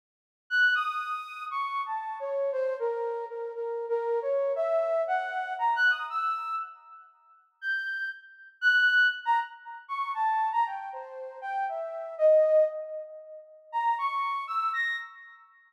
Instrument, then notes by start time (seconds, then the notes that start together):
flute
0.50 F#6
0.75 D#6
1.51 C#6
1.86 A5
2.20 C#5
2.52 C5
2.79 A#4
3.29 A#4
3.55 A#4
3.89 A#4
4.22 C#5
4.56 E5
5.07 F#5
5.59 A#5
5.76 F#6
5.90 D#6
6.10 E6
7.61 G6
8.61 F#6
9.25 A#5
9.88 C#6
10.14 A5
10.52 A#5
10.66 G5
10.93 C5
11.41 G5
11.69 E5
12.18 D#5
13.72 A#5
13.98 C#6
14.47 E6
14.73 A#6